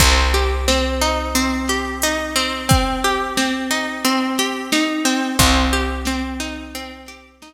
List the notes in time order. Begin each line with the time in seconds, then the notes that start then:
0.00 C2 C4, kick, closed hi-hat
0.34 G4
0.68 C4, snare
1.01 D#4
1.35 C4, closed hi-hat
1.68 G4, snare
2.02 D#4, closed hi-hat
2.36 C4
2.69 C4, kick, closed hi-hat
3.04 G4
3.37 C4, snare
3.71 D#4
4.04 C4, closed hi-hat
4.38 G4, snare
4.72 D#4, snare
5.05 C4
5.39 C2 C4, kick, closed hi-hat
5.73 G4
6.05 C4, snare
6.40 D#4
6.75 C4, closed hi-hat
7.06 G4, snare
7.42 D#4, snare